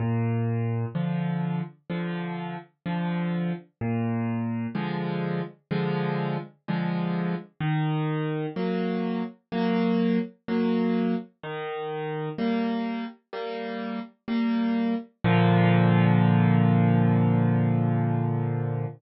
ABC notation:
X:1
M:4/4
L:1/8
Q:1/4=63
K:Bb
V:1 name="Acoustic Grand Piano"
B,,2 [D,F,]2 [D,F,]2 [D,F,]2 | B,,2 [D,F,_A,]2 [D,F,A,]2 [D,F,A,]2 | E,2 [_G,B,]2 [G,B,]2 [G,B,]2 | E,2 [G,B,]2 [G,B,]2 [G,B,]2 |
[B,,D,F,]8 |]